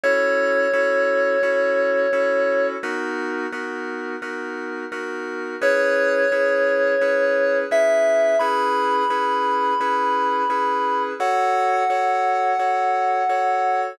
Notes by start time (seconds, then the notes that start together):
0.03 C#4 E4 F#4 A4 C#5
0.73 C#4 E4 F#4 A4
1.43 C#4 E4 F#4 A4
2.13 C#4 E4 F#4 A4
2.83 B3 D#4 F#4 A#4
3.52 B3 D#4 F#4 A#4
4.22 B3 D#4 F#4 A#4
4.92 B3 D#4 F#4 A#4
5.61 C#4 E4 G#4 B4 C#5
6.32 C#4 E4 G#4 B4
7.01 C#4 E4 G#4 B4
7.71 C#4 E4 G#4 B4 E5
8.39 C#4 E4 G#4 B4 B5
9.10 C#4 E4 G#4 B4
9.80 C#4 E4 G#4 B4
10.50 C#4 E4 G#4 B4
11.20 F#4 A4 C#5 F#5
11.90 F#4 A4 C#5
12.59 F#4 A4 C#5
13.29 F#4 A4 C#5